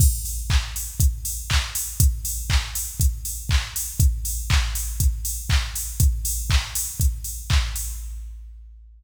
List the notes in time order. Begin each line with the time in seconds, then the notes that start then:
0.00 kick, crash
0.25 open hi-hat
0.50 kick, clap
0.76 open hi-hat
1.00 kick, closed hi-hat
1.25 open hi-hat
1.50 kick, clap
1.75 open hi-hat
2.00 kick, closed hi-hat
2.25 open hi-hat
2.50 kick, clap
2.75 open hi-hat
3.00 kick, closed hi-hat
3.25 open hi-hat
3.49 kick, clap
3.76 open hi-hat
4.00 kick, closed hi-hat
4.25 open hi-hat
4.50 kick, clap
4.75 open hi-hat
5.00 kick, closed hi-hat
5.25 open hi-hat
5.49 kick, clap
5.75 open hi-hat
6.00 kick, closed hi-hat
6.25 open hi-hat
6.50 kick, clap
6.75 open hi-hat
7.00 kick, closed hi-hat
7.24 open hi-hat
7.50 kick, clap
7.76 open hi-hat